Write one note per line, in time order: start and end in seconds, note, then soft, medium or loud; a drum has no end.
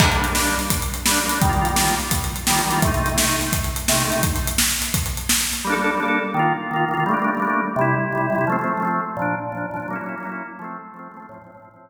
0.00 0.09 G3 loud
0.00 0.09 A#3 medium
0.00 kick loud
0.00 crash loud
0.05 0.09 D4 loud
0.12 0.27 G3 loud
0.12 0.27 A#3 medium
0.12 closed hi-hat medium
0.18 0.27 D4 medium
0.24 closed hi-hat medium
0.30 0.35 G3 medium
0.30 0.35 A#3 loud
0.35 0.55 G3 loud
0.35 0.55 A#3 medium
0.35 0.38 D4 medium
0.35 snare loud
0.41 0.55 D4 loud
0.47 closed hi-hat medium
0.59 closed hi-hat medium
0.70 kick medium
0.70 closed hi-hat loud
0.82 closed hi-hat medium
0.94 closed hi-hat medium
1.06 1.20 G3 loud
1.06 1.20 A#3 medium
1.06 snare loud
1.11 1.20 D4 loud
1.17 closed hi-hat medium
1.23 1.28 G3 loud
1.23 1.29 A#3 medium
1.28 1.39 G3 loud
1.28 1.39 A#3 medium
1.28 1.31 D4 medium
1.28 closed hi-hat loud
1.35 1.39 D4 medium
1.42 1.51 D#3 loud
1.42 1.51 G3 loud
1.42 kick loud
1.42 closed hi-hat loud
1.47 1.51 A#3 loud
1.47 1.52 F4 loud
1.53 1.68 D#3 loud
1.53 1.68 G3 medium
1.53 closed hi-hat medium
1.59 1.68 A#3 medium
1.59 1.68 F4 loud
1.65 closed hi-hat medium
1.71 1.75 D#3 loud
1.71 1.76 G3 loud
1.76 1.95 D#3 medium
1.76 1.95 G3 loud
1.76 1.79 A#3 loud
1.76 1.81 F4 loud
1.76 snare loud
1.82 1.95 A#3 medium
1.82 1.95 F4 medium
1.88 closed hi-hat medium
2.00 closed hi-hat medium
2.11 kick medium
2.11 closed hi-hat loud
2.24 closed hi-hat medium
2.36 closed hi-hat medium
2.47 2.61 D#3 medium
2.47 2.61 G3 loud
2.47 snare loud
2.52 2.61 A#3 loud
2.52 2.61 F4 medium
2.59 closed hi-hat medium
2.65 2.69 D#3 loud
2.65 2.70 G3 loud
2.70 2.80 D#3 loud
2.70 2.80 G3 medium
2.70 2.73 A#3 loud
2.70 2.75 F4 medium
2.70 closed hi-hat medium
2.76 2.80 A#3 loud
2.76 2.81 F4 loud
2.82 2.92 C3 loud
2.82 2.92 A3 loud
2.82 kick loud
2.82 closed hi-hat loud
2.87 2.92 D#4 loud
2.94 3.09 C3 loud
2.94 3.09 A3 loud
2.94 closed hi-hat medium
3.00 3.09 D#4 loud
3.06 closed hi-hat medium
3.12 3.16 C3 medium
3.12 3.17 A3 medium
3.17 3.36 C3 medium
3.17 3.36 A3 medium
3.17 3.20 D#4 medium
3.17 snare loud
3.22 3.36 D#4 medium
3.29 closed hi-hat medium
3.41 closed hi-hat medium
3.52 kick medium
3.52 closed hi-hat loud
3.64 closed hi-hat medium
3.76 closed hi-hat medium
3.88 4.03 C3 loud
3.88 4.03 A3 loud
3.88 snare loud
3.94 4.03 D#4 medium
4.00 closed hi-hat medium
4.05 4.09 C3 loud
4.05 4.10 A3 loud
4.10 4.22 C3 loud
4.10 4.13 D#4 medium
4.10 closed hi-hat medium
4.15 4.22 A3 medium
4.15 4.22 D#4 loud
4.23 kick loud
4.23 closed hi-hat loud
4.36 closed hi-hat medium
4.47 closed hi-hat loud
4.58 snare loud
4.70 closed hi-hat medium
4.82 closed hi-hat medium
4.94 kick medium
4.94 closed hi-hat loud
5.06 closed hi-hat medium
5.17 closed hi-hat medium
5.29 snare loud
5.41 closed hi-hat medium
5.53 closed hi-hat medium
5.65 5.74 G3 loud
5.65 5.74 A#3 loud
5.70 5.74 D4 loud
5.70 5.75 A4 loud
5.76 5.91 G3 medium
5.76 5.91 A#3 loud
5.82 5.91 D4 loud
5.82 5.91 A4 loud
5.95 6.00 G3 medium
5.95 6.00 A#3 medium
6.00 6.19 G3 medium
6.00 6.19 A#3 loud
6.00 6.03 D4 loud
6.00 6.05 A4 medium
6.05 6.19 D4 loud
6.05 6.19 A4 loud
6.34 6.53 D#3 loud
6.34 6.53 A#3 loud
6.39 6.53 F4 loud
6.71 6.85 D#3 medium
6.71 6.85 A#3 loud
6.76 6.85 F4 loud
6.88 6.93 D#3 medium
6.88 6.94 A#3 loud
6.93 7.04 D#3 loud
6.93 7.04 A#3 medium
6.93 6.96 F4 medium
7.00 7.04 F4 medium
7.06 7.15 G3 loud
7.06 7.15 A3 loud
7.11 7.15 A#3 loud
7.11 7.17 D4 loud
7.17 7.31 G3 medium
7.17 7.31 A3 medium
7.22 7.31 A#3 loud
7.22 7.31 D4 loud
7.35 7.39 G3 loud
7.35 7.40 A3 medium
7.40 7.61 G3 loud
7.40 7.43 A#3 loud
7.40 7.45 D4 medium
7.45 7.61 A3 loud
7.45 7.61 A#3 medium
7.50 7.61 D4 medium
7.76 7.95 C3 loud
7.76 7.95 G3 loud
7.81 7.95 E4 loud
8.12 8.27 C3 medium
8.12 8.27 G3 loud
8.17 8.27 E4 medium
8.30 8.35 C3 loud
8.30 8.35 G3 medium
8.35 8.45 C3 loud
8.35 8.45 G3 loud
8.35 8.38 E4 medium
8.41 8.45 E4 loud
8.47 8.57 F3 loud
8.47 8.57 A3 loud
8.52 8.57 C4 loud
8.59 8.73 F3 medium
8.59 8.73 A3 loud
8.64 8.73 C4 loud
8.77 8.82 F3 medium
8.77 8.83 A3 medium
8.82 9.01 F3 loud
8.82 9.01 A3 loud
8.82 8.85 C4 loud
8.87 9.01 C4 loud
9.17 9.35 A#2 loud
9.17 9.35 F3 loud
9.22 9.35 D4 loud
9.52 9.66 A#2 medium
9.52 9.66 F3 medium
9.57 9.66 D4 medium
9.71 9.76 A#2 medium
9.71 9.77 F3 loud
9.76 9.87 A#2 medium
9.76 9.87 F3 medium
9.76 9.79 D4 loud
9.82 9.87 D4 medium
9.88 9.97 F#3 loud
9.88 9.97 A#3 loud
9.93 9.97 C#4 loud
9.93 9.98 E4 loud
10.01 10.15 F#3 loud
10.01 10.15 A#3 medium
10.06 10.15 C#4 loud
10.06 10.15 E4 medium
10.18 10.22 F#3 loud
10.18 10.23 A#3 medium
10.23 10.43 F#3 loud
10.23 10.43 A#3 medium
10.23 10.26 C#4 loud
10.23 10.28 E4 loud
10.29 10.43 C#4 medium
10.29 10.43 E4 loud
10.59 10.78 F3 loud
10.59 10.78 A3 loud
10.64 10.78 C4 loud
10.94 11.08 F3 medium
10.94 11.08 A3 medium
10.99 11.08 C4 loud
11.11 11.16 F3 medium
11.11 11.17 A3 medium
11.16 11.27 F3 medium
11.16 11.27 A3 loud
11.16 11.19 C4 loud
11.22 11.27 C4 medium
11.29 11.38 A2 loud
11.29 11.38 F3 loud
11.34 11.38 C4 loud
11.42 11.51 A2 loud
11.42 11.51 F3 medium
11.47 11.51 C4 loud
11.52 11.57 A2 loud
11.52 11.58 F3 loud
11.57 11.69 A2 medium
11.57 11.60 C4 loud
11.62 11.69 F3 medium
11.62 11.69 C4 loud
11.71 11.90 A2 loud
11.71 11.90 F3 medium
11.76 11.90 C4 loud